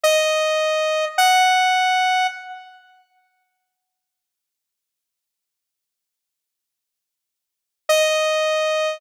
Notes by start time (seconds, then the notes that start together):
0.04 D#5
1.18 F#5
7.89 D#5